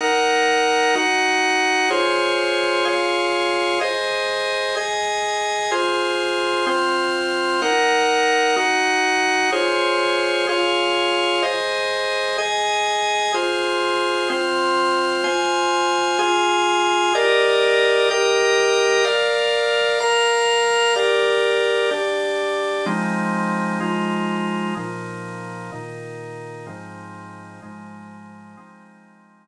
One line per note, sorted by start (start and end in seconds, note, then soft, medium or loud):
0.01 0.95 D#4 medium
0.01 0.95 A#4 medium
0.01 0.95 F#5 medium
0.95 1.90 D#4 medium
0.95 1.90 F#4 medium
0.95 1.90 F#5 medium
1.90 2.85 F4 medium
1.90 2.85 G#4 medium
1.90 2.85 C5 medium
1.90 2.85 C#5 medium
2.85 3.79 F4 medium
2.85 3.79 G#4 medium
2.85 3.79 C#5 medium
2.85 3.79 F5 medium
3.81 4.75 G#4 medium
3.81 4.75 C5 medium
3.81 4.75 D#5 medium
4.76 5.71 G#4 medium
4.76 5.71 D#5 medium
4.76 5.71 G#5 medium
5.71 6.66 F4 medium
5.71 6.66 G#4 medium
5.71 6.66 C5 medium
6.67 7.61 C4 medium
6.67 7.61 F4 medium
6.67 7.61 C5 medium
7.62 8.56 D#4 medium
7.62 8.56 A#4 medium
7.62 8.56 F#5 medium
8.56 9.51 D#4 medium
8.56 9.51 F#4 medium
8.56 9.51 F#5 medium
9.52 10.47 F4 medium
9.52 10.47 G#4 medium
9.52 10.47 C5 medium
9.52 10.47 C#5 medium
10.49 11.43 F4 medium
10.49 11.42 G#4 medium
10.49 11.43 C#5 medium
10.49 11.43 F5 medium
11.43 12.37 G#4 medium
11.43 12.37 C5 medium
11.43 12.37 D#5 medium
12.38 13.32 G#4 medium
12.38 13.32 D#5 medium
12.38 13.32 G#5 medium
13.34 14.28 F4 medium
13.34 14.28 G#4 medium
13.34 14.28 C5 medium
14.30 15.24 C4 medium
14.30 15.23 F4 medium
14.30 15.23 C5 medium
15.24 16.18 F4 medium
15.24 16.18 C5 medium
15.24 16.18 G#5 medium
16.19 17.13 F4 medium
16.19 17.13 G#4 medium
16.19 17.13 G#5 medium
17.15 18.09 G4 medium
17.15 18.09 A#4 medium
17.15 18.09 D5 medium
17.15 18.09 D#5 medium
18.11 19.05 G4 medium
18.11 19.04 A#4 medium
18.11 19.05 D#5 medium
18.11 19.05 G5 medium
19.04 19.99 A#4 medium
19.04 19.99 D5 medium
19.04 19.99 F5 medium
20.00 20.95 A#4 medium
20.00 20.95 F5 medium
20.00 20.95 A#5 medium
20.96 21.90 G4 medium
20.96 21.90 A#4 medium
20.96 21.90 D5 medium
21.91 22.85 D4 medium
21.91 22.85 G4 medium
21.91 22.85 D5 medium
22.86 23.80 F3 medium
22.86 23.80 G#3 medium
22.86 23.80 C4 medium
22.86 23.80 D#4 medium
23.80 24.75 F3 medium
23.80 24.75 G#3 medium
23.80 24.75 D#4 medium
23.80 24.75 F4 medium
24.77 25.71 A#2 medium
24.77 25.71 F3 medium
24.77 25.71 D#4 medium
25.72 26.66 A#2 medium
25.72 26.66 D#3 medium
25.72 26.66 D#4 medium
26.66 27.61 G#2 medium
26.66 27.61 F3 medium
26.66 27.61 C4 medium
26.66 27.61 D#4 medium
27.62 28.56 G#2 medium
27.62 28.56 F3 medium
27.62 28.56 G#3 medium
27.62 28.56 D#4 medium
28.57 29.47 F3 medium
28.57 29.47 G#3 medium
28.57 29.47 C4 medium
28.57 29.47 D#4 medium